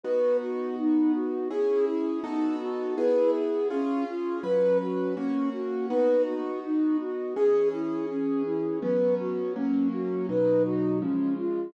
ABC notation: X:1
M:4/4
L:1/8
Q:1/4=82
K:B
V:1 name="Flute"
B F D F G E D F | B G C ^E B F C F | B F D F G E C E | B F C F B F C ^E |]
V:2 name="Acoustic Grand Piano"
[B,DF]4 [CEG]2 [B,DF=A]2 | [B,EG]2 [C^EG]2 [F,CB]2 [A,CF]2 | [B,DF]4 [E,CG]4 | [F,B,C]2 [F,A,C]2 [B,,F,D]2 [C,^E,G,]2 |]